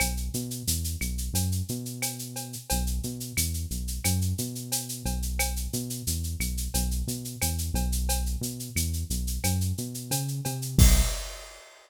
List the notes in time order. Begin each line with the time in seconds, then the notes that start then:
0.00 B1, cowbell, claves, shaker
0.17 shaker
0.34 B2, shaker
0.51 shaker
0.67 E2, shaker
0.84 shaker
1.01 B1, claves, shaker
1.18 shaker
1.33 F#2, cowbell, shaker
1.52 shaker
1.69 B2, shaker
1.85 shaker
2.02 cowbell, claves, shaker
2.19 shaker
2.36 cowbell, shaker
2.53 shaker
2.70 B1, cowbell, shaker
2.87 shaker
3.03 B2, shaker
3.20 shaker
3.37 E2, claves, shaker
3.54 shaker
3.71 B1, shaker
3.88 shaker
4.04 F#2, cowbell, claves, shaker
4.21 shaker
4.38 B2, shaker
4.55 shaker
4.72 cowbell, shaker
4.89 shaker
5.05 B1, cowbell, shaker
5.22 shaker
5.39 cowbell, claves, shaker
5.56 shaker
5.73 B2, shaker
5.90 shaker
6.07 E2, shaker
6.24 shaker
6.39 B1, claves, shaker
6.57 shaker
6.74 B1, cowbell, shaker
6.91 shaker
7.07 B2, shaker
7.25 shaker
7.42 E2, cowbell, claves, shaker
7.58 shaker
7.74 B1, cowbell, shaker
7.92 shaker
8.09 cowbell, shaker
8.26 shaker
8.41 B2, shaker
8.60 shaker
8.75 E2, claves, shaker
8.93 shaker
9.10 B1, shaker
9.27 shaker
9.44 F#2, cowbell, claves, shaker
9.61 shaker
9.78 B2, shaker
9.94 shaker
10.11 C#3, cowbell, shaker
10.28 shaker
10.45 C3, cowbell, shaker
10.62 shaker
10.78 B1, kick, crash